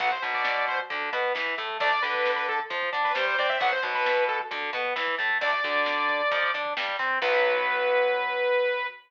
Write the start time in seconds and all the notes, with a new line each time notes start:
0.00 B1 F#3 B3 F#5, kick, closed hi-hat
0.11 C5, kick
0.22 B1 B2, kick, closed hi-hat
0.34 D5, kick
0.45 kick, snare
0.56 kick
0.68 C5, kick, closed hi-hat
0.79 kick
0.90 D2 D3, kick, closed hi-hat
1.02 kick
1.13 B2 B3, kick, snare, closed hi-hat
1.24 kick
1.34 E2 E3, kick, snare
1.47 kick
1.58 A2 A3, kick, closed hi-hat
1.69 kick
1.80 D2 A3 D4 D5, kick, closed hi-hat
1.92 kick
2.02 D2 D3 B4, kick, closed hi-hat
2.14 kick
2.25 kick, snare
2.36 B4, kick
2.48 A4, kick, closed hi-hat
2.60 kick
2.70 F2 F3, kick, closed hi-hat
2.82 kick
2.93 D3 D4, kick, snare, closed hi-hat
3.04 B4, kick
3.15 G2 G3 C5, kick, snare
3.27 C5, kick
3.38 C3 C4 D5, kick, closed hi-hat
3.49 E5, kick
3.60 B1 F#3 B3 F#5, kick, closed hi-hat
3.72 C5, kick
3.83 B1 B2, kick, closed hi-hat
3.94 B4, kick
4.06 kick, snare
4.17 kick
4.28 A4, kick, closed hi-hat
4.40 kick
4.51 D2 D3, kick, closed hi-hat
4.62 kick
4.73 B2 B3, kick, snare, closed hi-hat
4.85 kick
4.96 E2 E3, kick, snare
5.07 kick
5.18 A2 A3, kick, closed hi-hat
5.30 kick
5.41 D2 A3 D4 D5, kick, closed hi-hat
5.53 kick
5.64 D2 D3, kick, closed hi-hat
5.75 kick
5.86 kick, snare
5.98 kick
6.09 kick, closed hi-hat
6.21 kick
6.31 F2 F3, kick, closed hi-hat
6.43 kick
6.54 D3 D4, kick, snare, closed hi-hat
6.65 kick
6.77 G2 G3, kick, snare
6.89 kick
6.99 C3 C4, kick, closed hi-hat
7.11 kick
7.22 B1 F#3 B3 B4, kick, crash